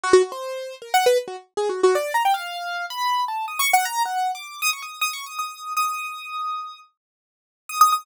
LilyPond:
\new Staff { \time 3/4 \tempo 4 = 157 fis'16 fis'16 fis'16 c''4~ c''16 \tuplet 3/2 { ais'8 fis''8 b'8 } | r16 fis'16 r8 \tuplet 3/2 { gis'8 fis'8 fis'8 } d''8 ais''16 g''16 | f''4. b''4 a''8 | \tuplet 3/2 { dis'''8 cis'''8 fis''8 } ais''8 fis''8. d'''8. |
dis'''16 cis'''16 dis'''8 \tuplet 3/2 { dis'''8 cis'''8 dis'''8 } dis'''4 | dis'''2. | r2 \tuplet 3/2 { dis'''8 dis'''8 dis'''8 } | }